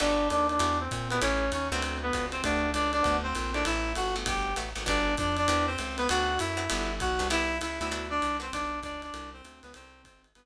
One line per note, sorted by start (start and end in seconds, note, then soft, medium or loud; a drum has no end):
0.00 0.30 G1 medium
0.00 0.23 B3 medium
0.00 0.28 D4 loud
0.00 0.23 F#4 medium
0.00 0.23 G4 medium
0.00 0.23 A4 medium
0.00 0.28 D5 loud
0.00 crash loud
0.00 ride loud
0.30 0.59 D#2 medium
0.30 0.47 D4 loud
0.30 0.47 D5 loud
0.30 hi-hat pedal medium
0.30 ride medium
0.49 0.78 D4 medium
0.49 0.78 D5 medium
0.49 ride medium
0.59 0.88 E2 medium
0.59 0.83 D4 medium
0.59 0.83 E4 medium
0.59 0.83 F#4 medium
0.59 0.83 G4 medium
0.59 ride loud
0.80 1.08 C4 medium
0.80 1.08 C5 loud
0.91 1.20 A#2 medium
0.91 kick medium
0.91 hi-hat pedal medium
0.91 ride medium
1.10 1.21 B3 medium
1.10 1.20 D4 medium
1.10 1.20 E4 medium
1.10 1.20 F#4 medium
1.10 1.20 G4 medium
1.10 1.21 B4 loud
1.10 ride medium
1.22 1.51 A1 medium
1.22 1.51 C#4 loud
1.22 1.46 C#4 medium
1.22 1.46 E4 medium
1.22 1.46 G4 medium
1.22 1.46 A4 medium
1.22 1.51 C#5 loud
1.22 ride loud
1.52 1.70 D#2 medium
1.52 1.69 C#4 medium
1.52 1.69 C#5 medium
1.52 hi-hat pedal medium
1.52 ride medium
1.72 2.11 D2 medium
1.72 2.07 B3 medium
1.72 1.96 C4 medium
1.72 2.07 C4 medium
1.72 2.07 D4 medium
1.72 2.07 F#4 medium
1.72 1.96 C5 loud
1.72 ride medium
1.82 ride loud
2.03 2.26 B3 medium
2.03 2.26 B4 loud
2.13 2.42 C#2 medium
2.13 2.38 B3 medium
2.13 2.38 C4 medium
2.13 2.38 D4 medium
2.13 2.38 F#4 medium
2.13 kick medium
2.13 hi-hat pedal medium
2.13 ride medium
2.32 2.42 C4 medium
2.32 2.42 C5 loud
2.32 ride medium
2.43 2.73 D2 medium
2.43 2.67 A3 medium
2.43 2.67 B3 medium
2.43 2.70 D4 loud
2.43 2.67 F#4 medium
2.43 2.67 G4 medium
2.43 2.70 D5 loud
2.43 kick medium
2.43 ride loud
2.74 3.02 C#2 medium
2.74 2.91 D4 medium
2.74 2.91 D5 loud
2.74 hi-hat pedal medium
2.74 ride medium
2.92 3.16 D4 medium
2.92 3.16 D5 loud
2.92 ride medium
3.03 3.34 D2 medium
3.03 3.26 B3 medium
3.03 3.26 C4 medium
3.03 3.26 D4 medium
3.03 3.26 F#4 medium
3.03 kick medium
3.03 ride medium
3.23 3.51 C4 medium
3.23 3.51 C5 loud
3.35 3.64 A#1 medium
3.35 hi-hat pedal medium
3.35 ride medium
3.54 3.89 A3 medium
3.54 3.89 C4 medium
3.54 3.64 D4 medium
3.54 3.89 E4 medium
3.54 3.89 G4 medium
3.54 3.64 D5 loud
3.54 ride medium
3.65 3.94 A1 medium
3.65 3.92 E4 loud
3.65 3.92 E5 loud
3.65 ride loud
3.95 4.24 G1 medium
3.95 4.15 F#4 medium
3.95 4.15 F#5 loud
3.95 hi-hat pedal medium
3.95 ride medium
4.16 4.51 A3 medium
4.16 4.51 B3 medium
4.16 4.51 F#4 medium
4.16 4.51 G4 medium
4.16 ride medium
4.26 4.54 G1 medium
4.26 4.54 G4 medium
4.26 4.54 G5 medium
4.26 kick medium
4.26 ride loud
4.56 4.74 A1 medium
4.56 4.70 A3 medium
4.56 4.70 B3 medium
4.56 4.70 F#4 medium
4.56 4.70 G4 medium
4.56 hi-hat pedal medium
4.56 ride medium
4.75 4.86 G#1 medium
4.75 4.83 A3 medium
4.75 4.83 B3 medium
4.75 4.83 F#4 medium
4.75 4.83 G4 medium
4.75 ride medium
4.86 5.16 G1 medium
4.86 5.10 B3 medium
4.86 5.10 D4 medium
4.86 5.15 D4 loud
4.86 5.10 F#4 medium
4.86 5.10 G4 medium
4.86 5.15 D5 loud
4.86 kick medium
4.86 ride loud
5.17 5.47 F2 medium
5.17 5.36 D4 medium
5.17 5.36 D5 loud
5.17 kick medium
5.17 hi-hat pedal medium
5.17 ride medium
5.37 5.66 D4 loud
5.37 5.66 D5 loud
5.37 ride medium
5.48 5.76 E2 medium
5.48 5.73 B3 medium
5.48 5.73 C4 medium
5.48 5.73 E4 medium
5.48 5.73 G4 medium
5.48 ride loud
5.67 5.96 C4 medium
5.67 5.96 C5 loud
5.78 6.08 C#2 medium
5.78 hi-hat pedal medium
5.78 ride medium
5.98 6.08 B3 loud
5.98 6.08 B4 loud
5.98 ride medium
6.09 6.39 D2 medium
6.09 6.35 B3 medium
6.09 6.35 C4 medium
6.09 6.35 D4 medium
6.09 6.39 F#4 loud
6.09 6.35 F#4 medium
6.09 6.39 F#5 loud
6.09 ride loud
6.39 6.68 F#2 medium
6.39 6.92 E4 medium
6.39 6.92 E5 loud
6.39 hi-hat pedal loud
6.39 ride medium
6.57 6.65 B3 medium
6.57 6.65 C4 medium
6.57 6.65 D4 medium
6.57 6.65 F#4 medium
6.57 ride medium
6.70 7.00 G1 medium
6.70 6.94 B3 medium
6.70 6.94 D4 loud
6.70 6.94 F#4 medium
6.70 6.94 G4 medium
6.70 ride loud
7.00 7.19 B1 medium
7.00 7.28 F#4 medium
7.00 7.28 F#5 loud
7.00 kick medium
7.00 hi-hat pedal medium
7.00 ride medium
7.19 7.60 C2 medium
7.19 7.27 B3 medium
7.19 7.27 D4 medium
7.19 7.27 F#4 medium
7.19 7.27 G4 medium
7.19 ride medium
7.30 7.54 B3 medium
7.30 7.54 C4 medium
7.30 7.54 E4 medium
7.30 7.58 E4 loud
7.30 7.54 G4 medium
7.30 7.58 E5 loud
7.30 ride loud
7.61 7.79 C#2 medium
7.61 7.79 E4 loud
7.61 7.79 E5 loud
7.61 hi-hat pedal medium
7.61 ride loud
7.81 8.20 D2 medium
7.81 7.89 B3 medium
7.81 7.89 C4 medium
7.81 8.07 E4 medium
7.81 7.89 E4 medium
7.81 7.89 G4 medium
7.81 8.07 E5 loud
7.81 ride medium
7.91 8.15 B3 medium
7.91 8.15 C4 medium
7.91 8.15 D4 medium
7.91 8.15 F#4 medium
7.91 ride loud
8.10 8.37 D4 loud
8.10 8.37 D5 loud
8.22 8.51 C2 medium
8.22 hi-hat pedal medium
8.22 ride medium
8.40 8.48 B3 medium
8.40 8.48 C4 medium
8.40 8.51 C4 loud
8.40 8.48 D4 medium
8.40 8.48 F#4 medium
8.40 8.51 C5 loud
8.40 ride medium
8.53 8.81 B1 medium
8.53 8.80 D4 loud
8.53 8.80 D5 loud
8.53 kick medium
8.53 ride loud
8.83 9.11 C#2 medium
8.83 9.01 D4 loud
8.83 9.01 D5 loud
8.83 kick medium
8.83 hi-hat pedal medium
8.83 ride medium
9.02 9.30 D4 medium
9.02 9.30 D5 loud
9.02 ride medium
9.14 9.42 C2 medium
9.14 ride loud
9.33 9.60 C4 medium
9.33 9.60 C5 loud
9.44 9.62 D2 medium
9.44 hi-hat pedal medium
9.44 ride medium
9.63 9.74 C#2 medium
9.63 9.73 B3 medium
9.63 9.73 B4 loud
9.63 ride medium
9.74 10.04 C2 medium
9.74 10.02 C4 loud
9.74 10.02 C5 loud
9.74 ride loud
10.05 10.33 G#1 medium
10.05 10.22 C4 medium
10.05 10.22 C5 loud
10.05 kick medium
10.05 hi-hat pedal medium
10.05 ride loud
10.24 ride medium
10.35 10.45 G1 medium
10.35 10.45 B3 medium
10.35 10.45 B4 loud
10.35 ride loud